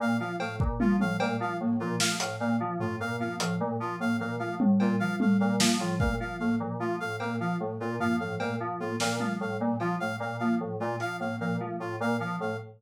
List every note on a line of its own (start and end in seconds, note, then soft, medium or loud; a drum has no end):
0.00 0.16 A#2 medium
0.00 0.16 A#3 medium
0.00 0.17 F5 medium
0.20 0.36 F3 medium
0.20 0.36 F5 medium
0.40 0.56 A2 medium
0.40 0.56 A3 medium
0.40 0.56 F5 medium
0.40 cowbell medium
0.60 0.76 A#2 medium
0.60 kick medium
0.80 0.96 F3 medium
0.80 0.96 A#3 medium
0.80 0.96 F4 medium
0.80 high tom medium
1.00 1.16 A2 medium
1.00 1.17 F3 medium
1.00 1.17 F5 medium
1.00 high tom medium
1.20 1.36 A#2 medium
1.20 1.37 A3 medium
1.20 1.36 F5 medium
1.20 cowbell loud
1.40 1.56 F3 medium
1.40 1.57 F5 medium
1.60 1.76 A2 medium
1.60 1.76 A#3 medium
1.80 1.96 A#2 medium
1.80 1.96 F3 medium
1.80 1.96 F4 medium
2.00 2.16 F3 medium
2.00 2.16 A3 medium
2.00 2.16 F5 medium
2.00 snare loud
2.20 2.37 A2 medium
2.20 2.36 F5 medium
2.20 closed hi-hat loud
2.40 2.56 A#2 medium
2.40 2.56 A#3 medium
2.40 2.56 F5 medium
2.60 2.76 F3 medium
2.60 2.77 F3 medium
2.80 2.96 A2 medium
2.80 2.96 A3 medium
2.80 2.96 F4 medium
2.80 floor tom medium
3.00 3.16 A#2 medium
3.00 3.16 F5 medium
3.19 3.36 F3 medium
3.19 3.35 A#3 medium
3.19 3.36 F5 medium
3.39 3.56 A2 medium
3.39 3.57 F3 medium
3.39 3.55 F5 medium
3.39 closed hi-hat loud
3.59 3.76 A#2 medium
3.59 3.75 A3 medium
3.80 3.96 F3 medium
3.80 3.96 F4 medium
4.00 4.16 A2 medium
4.00 4.16 A#3 medium
4.00 4.17 F5 medium
4.19 4.36 A#2 medium
4.19 4.35 F3 medium
4.19 4.36 F5 medium
4.39 4.56 F3 medium
4.39 4.56 A3 medium
4.39 4.55 F5 medium
4.60 4.76 A2 medium
4.60 high tom medium
4.80 4.96 A#2 medium
4.80 4.96 A#3 medium
4.80 4.96 F4 medium
4.80 cowbell medium
5.00 5.16 F3 medium
5.00 5.16 F5 medium
5.19 5.36 A2 medium
5.19 5.35 A3 medium
5.19 5.37 F5 medium
5.19 high tom medium
5.40 5.57 A#2 medium
5.40 5.56 F5 medium
5.60 5.76 F3 medium
5.60 5.76 A#3 medium
5.60 snare loud
5.79 5.96 A2 medium
5.79 5.97 F3 medium
5.79 5.96 F4 medium
5.99 6.16 A#2 medium
5.99 6.16 A3 medium
5.99 6.15 F5 medium
5.99 kick medium
6.20 6.36 F3 medium
6.20 6.36 F5 medium
6.39 6.56 A2 medium
6.39 6.55 A#3 medium
6.39 6.55 F5 medium
6.60 6.76 A#2 medium
6.60 6.76 F3 medium
6.80 6.96 F3 medium
6.80 6.96 A3 medium
6.80 6.96 F4 medium
7.00 7.17 A2 medium
7.00 7.16 F5 medium
7.20 7.36 A#2 medium
7.20 7.36 A#3 medium
7.20 7.36 F5 medium
7.20 cowbell medium
7.40 7.56 F3 medium
7.40 7.56 F5 medium
7.60 7.76 A2 medium
7.60 7.76 A3 medium
7.80 7.96 A#2 medium
7.80 7.96 F4 medium
8.00 8.16 F3 medium
8.00 8.16 A#3 medium
8.00 8.16 F5 medium
8.00 floor tom medium
8.20 8.36 A2 medium
8.20 8.36 F3 medium
8.20 8.36 F5 medium
8.39 8.56 A#2 medium
8.39 8.55 A3 medium
8.39 8.56 F5 medium
8.39 cowbell medium
8.60 8.76 F3 medium
8.80 8.96 A2 medium
8.80 8.96 A#3 medium
8.80 8.96 F4 medium
9.00 9.16 A#2 medium
9.00 9.17 F3 medium
9.00 9.16 F5 medium
9.00 snare medium
9.19 9.36 F3 medium
9.19 9.36 A3 medium
9.19 9.35 F5 medium
9.19 high tom medium
9.40 9.56 A2 medium
9.40 9.57 F5 medium
9.60 9.76 A#2 medium
9.60 9.76 A#3 medium
9.79 9.96 F3 medium
9.79 9.96 F4 medium
9.79 cowbell medium
10.00 10.16 A2 medium
10.00 10.17 A3 medium
10.00 10.16 F5 medium
10.20 10.36 A#2 medium
10.20 10.37 F5 medium
10.39 10.56 F3 medium
10.39 10.56 A#3 medium
10.39 10.55 F5 medium
10.60 10.76 A2 medium
10.60 10.76 F3 medium
10.79 10.96 A#2 medium
10.79 10.95 A3 medium
10.79 10.96 F4 medium
11.00 11.16 F3 medium
11.00 11.17 F5 medium
11.00 closed hi-hat medium
11.20 11.36 A2 medium
11.20 11.36 A#3 medium
11.20 11.36 F5 medium
11.40 11.57 A#2 medium
11.40 11.56 F3 medium
11.40 11.56 F5 medium
11.60 11.76 F3 medium
11.60 11.76 A3 medium
11.80 11.96 A2 medium
11.80 11.96 F4 medium
12.00 12.16 A#2 medium
12.00 12.17 A#3 medium
12.00 12.17 F5 medium
12.20 12.36 F3 medium
12.20 12.36 F5 medium
12.39 12.56 A2 medium
12.39 12.55 A3 medium
12.39 12.57 F5 medium